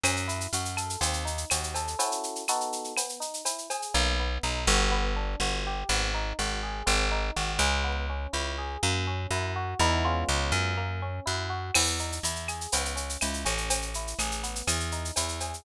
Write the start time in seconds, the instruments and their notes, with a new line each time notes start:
0.03 electric bass (finger) F#2, electric piano 1 C#4, cowbell, claves, shaker
0.16 shaker
0.27 electric piano 1 E4, shaker
0.41 shaker
0.53 electric bass (finger) F#2, electric piano 1 F#4, shaker
0.65 shaker
0.77 electric piano 1 A4, claves, shaker
0.90 shaker
1.00 electric bass (finger) D#2, electric piano 1 C4, cowbell, shaker
1.13 shaker
1.25 electric piano 1 D#4, shaker
1.38 shaker
1.50 electric bass (finger) D#2, electric piano 1 F#4, cowbell, claves, shaker
1.63 shaker
1.74 electric piano 1 A4, cowbell, shaker
1.88 shaker
1.99 electric piano 1 C#4 E4 F#4 A4, cowbell, shaker
2.12 shaker
2.23 shaker
2.35 shaker
2.48 electric piano 1 B3 D#4 F#4 A4, claves, shaker
2.61 shaker
2.72 shaker
2.84 shaker
2.97 electric piano 1 B3, cowbell, claves, shaker
3.09 shaker
3.20 electric piano 1 D#4, shaker
3.34 shaker
3.45 electric piano 1 E4, cowbell, shaker
3.58 shaker
3.70 electric piano 1 G#4, cowbell, shaker
3.82 shaker
3.94 electric bass (finger) B1, electric piano 1 A#3
4.19 electric piano 1 B3
4.43 electric bass (finger) B1, electric piano 1 D#4
4.67 electric bass (finger) G1, electric piano 1 F#4
4.91 electric piano 1 B3
5.16 electric piano 1 D4
5.40 electric bass (finger) G1, electric piano 1 F#4
5.66 electric piano 1 G4
5.89 electric bass (finger) G#1, electric piano 1 B3
6.14 electric piano 1 D#4
6.39 electric bass (finger) G#1, electric piano 1 F#4
6.63 electric piano 1 G#4
6.86 electric bass (finger) G#1, electric piano 1 C4
7.11 electric piano 1 D#4
7.36 electric bass (finger) G#1, electric piano 1 F#4
7.59 electric bass (finger) C#2, electric piano 1 G#4
7.84 electric piano 1 B3
8.09 electric piano 1 C#4
8.33 electric bass (finger) C#2, electric piano 1 E4
8.58 electric piano 1 G#4
8.83 electric bass (finger) F#2, electric piano 1 A#3
9.07 electric piano 1 C#4
9.30 electric bass (finger) F#2, electric piano 1 E4
9.56 electric piano 1 F#4
9.79 electric bass (finger) E2, electric piano 1 G#3 B3 D#4 E4
10.04 electric piano 1 G#3 B3 C#4 F4
10.28 electric bass (finger) C#2
10.52 electric bass (finger) F#2
10.77 electric piano 1 A#3
11.02 electric piano 1 C#4
11.25 electric bass (finger) F#2, electric piano 1 E4
11.49 electric piano 1 F#4
11.74 electric bass (finger) E2, electric piano 1 B3, crash, cowbell, claves
11.87 shaker
11.99 electric piano 1 D#4, shaker
12.12 shaker
12.23 electric bass (finger) E2, electric piano 1 E4, shaker
12.36 shaker
12.48 electric piano 1 G#4, claves, shaker
12.61 shaker
12.72 electric bass (finger) C#2, electric piano 1 B3, cowbell, shaker
12.85 shaker
12.96 electric piano 1 C#4, shaker
13.09 shaker
13.21 electric bass (finger) C#2, electric piano 1 E4, cowbell, claves, shaker
13.34 shaker
13.45 electric bass (finger) A1, electric piano 1 C#4, cowbell, shaker
13.58 shaker
13.70 cowbell, shaker
13.82 shaker
13.94 electric piano 1 E4, shaker
14.07 shaker
14.19 electric bass (finger) A1, electric piano 1 G#4, claves, shaker
14.31 shaker
14.43 electric piano 1 B3, shaker
14.55 shaker
14.67 electric bass (finger) E2, cowbell, claves, shaker
14.80 shaker
14.92 electric piano 1 D#4, shaker
15.05 shaker
15.16 electric bass (finger) E2, electric piano 1 E4, cowbell, shaker
15.29 shaker
15.40 electric piano 1 G#4, cowbell, shaker
15.54 shaker